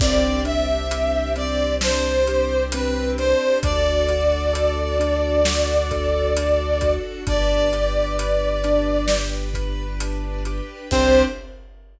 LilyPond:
<<
  \new Staff \with { instrumentName = "Brass Section" } { \time 4/4 \key c \lydian \tempo 4 = 66 d''8 e''4 d''8 c''4 b'8 c''8 | d''1 | d''2~ d''8 r4. | c''4 r2. | }
  \new Staff \with { instrumentName = "Acoustic Grand Piano" } { \time 4/4 \key c \lydian c'8 d'8 g'8 c'8 d'8 g'8 c'8 d'8 | d'8 fis'8 a'8 d'8 fis'8 a'8 d'8 fis'8 | d'8 g'8 b'8 d'8 g'8 b'8 d'8 g'8 | <c' d' g'>4 r2. | }
  \new Staff \with { instrumentName = "Synth Bass 2" } { \clef bass \time 4/4 \key c \lydian c,1 | d,1 | g,,1 | c,4 r2. | }
  \new Staff \with { instrumentName = "String Ensemble 1" } { \time 4/4 \key c \lydian <c' d' g'>1 | <d' fis' a'>1 | <d' g' b'>1 | <c' d' g'>4 r2. | }
  \new DrumStaff \with { instrumentName = "Drums" } \drummode { \time 4/4 <cymc bd>8 hh8 hh8 hh8 sn8 hh8 hh8 hh8 | <hh bd>8 hh8 hh8 hh8 sn8 <hh bd>8 hh8 <hh bd>8 | <hh bd>8 hh8 hh8 hh8 sn8 <hh bd>8 hh8 hh8 | <cymc bd>4 r4 r4 r4 | }
>>